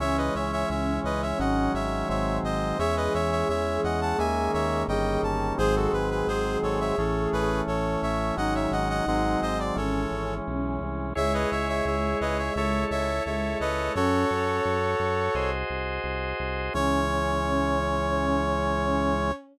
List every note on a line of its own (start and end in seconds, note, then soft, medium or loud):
0.00 0.30 C#2 loud
0.00 1.38 E3 medium
0.00 1.38 G#3 medium
0.00 1.70 C#4 loud
0.00 1.38 C#4 medium
0.00 0.17 C#5 medium
0.00 0.17 E5 medium
0.17 0.34 B4 medium
0.17 0.34 D#5 medium
0.35 0.64 C#2 medium
0.35 0.51 C#5 medium
0.35 0.51 E5 medium
0.52 0.69 C#5 medium
0.52 0.69 E5 medium
0.70 0.99 C#2 loud
0.70 1.00 C#5 medium
0.70 1.00 E5 medium
1.04 1.34 C#2 medium
1.04 1.21 B4 medium
1.04 1.21 D#5 medium
1.22 1.39 C#5 medium
1.22 1.39 E5 medium
1.39 1.69 G#1 loud
1.39 2.08 D#3 medium
1.39 2.08 F#3 medium
1.39 2.08 G#3 medium
1.39 2.08 C#4 medium
1.39 1.72 D#5 medium
1.39 1.72 F#5 medium
1.74 2.04 G#1 medium
1.74 2.08 C#5 medium
1.74 2.08 E5 medium
2.09 2.39 G#1 loud
2.09 2.78 D#3 medium
2.09 2.78 F#3 medium
2.09 2.78 G#3 medium
2.09 2.78 C4 medium
2.09 2.38 C#5 medium
2.09 2.38 E5 medium
2.43 2.73 G#1 medium
2.43 2.78 C5 medium
2.43 2.78 D#5 medium
2.79 3.09 E2 loud
2.79 4.17 E3 medium
2.79 4.17 G#3 medium
2.79 4.17 C#4 medium
2.79 4.78 G#4 medium
2.79 2.96 C#5 medium
2.79 2.96 E5 medium
2.97 3.13 B4 medium
2.97 3.13 D#5 medium
3.14 3.44 E2 medium
3.14 3.31 C#5 medium
3.14 3.31 E5 medium
3.31 3.48 C#5 medium
3.31 3.48 E5 medium
3.49 3.78 E2 medium
3.49 3.81 C#5 medium
3.49 3.81 E5 medium
3.84 4.14 E2 loud
3.84 4.00 D#5 medium
3.84 4.00 F#5 medium
4.01 4.18 F#5 medium
4.01 4.18 A5 medium
4.18 4.49 D#2 loud
4.18 4.87 D#3 medium
4.18 4.87 G#3 medium
4.18 4.87 A#3 medium
4.18 4.87 C#4 medium
4.18 4.51 E5 medium
4.18 4.51 G#5 medium
4.53 4.84 D#2 medium
4.53 4.83 C#5 medium
4.53 4.83 E5 medium
4.88 5.18 G1 loud
4.88 5.57 D#3 medium
4.88 5.58 G3 medium
4.88 5.58 A#3 medium
4.88 5.58 C#4 medium
4.88 5.46 G#4 medium
4.88 5.21 D#5 medium
4.88 5.21 G5 medium
5.23 5.52 G1 loud
5.23 5.53 A5 medium
5.58 5.88 G#1 loud
5.58 6.96 D#3 medium
5.58 6.96 F#3 medium
5.58 6.96 G#3 medium
5.58 6.96 C4 medium
5.58 7.46 G#4 loud
5.58 5.75 G#4 medium
5.58 5.75 C5 medium
5.76 5.92 F#4 medium
5.76 5.92 A4 medium
5.93 6.23 G#1 medium
5.93 6.10 B4 medium
6.11 6.27 B4 medium
6.27 6.57 G#1 medium
6.27 6.58 G#4 medium
6.27 6.58 C5 medium
6.63 6.92 G#1 medium
6.63 6.79 A4 medium
6.63 6.79 C#5 medium
6.80 6.97 C#5 medium
6.80 6.97 E5 medium
6.98 7.27 A1 loud
6.98 8.37 E3 medium
6.98 8.37 A3 medium
6.98 8.36 C#4 medium
6.98 7.29 A4 medium
6.98 7.29 C#5 medium
7.33 7.62 A1 loud
7.33 7.61 G#4 medium
7.33 7.61 B4 medium
7.67 7.97 A1 medium
7.67 8.01 A4 medium
7.67 8.01 C#5 medium
8.02 8.32 A1 loud
8.02 8.34 C#5 medium
8.02 8.34 E5 medium
8.37 8.67 G#1 loud
8.37 9.06 D#3 medium
8.37 9.06 F#3 medium
8.37 9.06 G#3 medium
8.37 9.06 C#4 medium
8.37 9.54 D#4 loud
8.37 8.54 D#5 medium
8.37 8.54 F#5 medium
8.55 8.71 C#5 medium
8.55 8.71 E5 medium
8.71 9.01 G#1 loud
8.71 8.89 D#5 medium
8.71 8.89 F#5 medium
8.90 9.06 D#5 medium
8.90 9.06 F#5 medium
9.07 9.36 G#1 loud
9.07 9.77 D#3 medium
9.07 9.77 F#3 medium
9.07 9.75 G#3 medium
9.07 9.77 C4 medium
9.07 9.40 D#5 medium
9.07 9.40 F#5 medium
9.42 9.72 G#1 medium
9.42 9.58 C5 medium
9.42 9.58 D#5 medium
9.59 9.76 D5 medium
9.75 10.06 G#1 loud
9.75 11.14 E3 medium
9.75 11.14 G#3 medium
9.75 11.14 C#4 medium
9.75 10.78 C#4 medium
9.75 10.34 A4 medium
9.75 10.34 C#5 medium
10.11 10.41 G#1 medium
10.47 10.79 B1 medium
10.81 11.13 C2 medium
11.15 11.46 C#2 loud
11.15 13.08 G#3 loud
11.15 12.53 E4 medium
11.15 12.53 G#4 medium
11.15 12.53 C#5 medium
11.15 11.33 C#5 medium
11.15 11.33 E5 medium
11.34 11.50 B4 medium
11.34 11.50 D#5 medium
11.51 11.82 C#2 medium
11.51 11.68 C#5 medium
11.51 11.68 E5 medium
11.69 11.85 C#5 medium
11.69 11.85 E5 medium
11.85 12.15 C#2 loud
11.85 12.18 C#5 medium
11.85 12.18 E5 medium
12.21 12.50 C#2 loud
12.21 12.37 B4 medium
12.21 12.37 D#5 medium
12.38 12.55 C#5 medium
12.38 12.55 E5 medium
12.56 12.85 C#2 loud
12.56 13.95 E4 medium
12.56 13.95 A4 medium
12.56 12.84 C#5 medium
12.56 13.95 C#5 medium
12.56 12.84 E5 medium
12.91 13.20 C#2 medium
12.91 13.23 C#5 medium
12.91 13.23 E5 medium
13.26 13.56 C#2 medium
13.26 13.90 G#3 medium
13.26 13.58 C#5 medium
13.26 13.58 E5 medium
13.60 13.90 C#2 medium
13.60 13.92 B4 medium
13.60 13.92 D#5 medium
13.95 14.25 F#2 loud
13.95 14.57 C#4 loud
13.95 15.35 F#4 medium
13.95 15.50 A4 medium
13.95 15.35 A4 medium
13.95 15.50 C#5 medium
13.95 15.35 C#5 medium
14.31 14.60 F#2 medium
14.65 14.95 F#2 loud
14.99 15.29 F#2 medium
15.34 15.64 C2 loud
15.34 16.73 F#4 medium
15.34 16.73 G#4 medium
15.34 16.73 C5 medium
15.34 16.73 D#5 medium
15.70 15.99 C2 medium
16.04 16.34 C2 medium
16.40 16.69 C2 medium
16.74 19.32 C#2 loud
16.74 19.32 E3 medium
16.74 19.32 G#3 loud
16.74 19.32 C#4 medium
16.74 19.32 C#4 loud
16.74 19.32 C#5 loud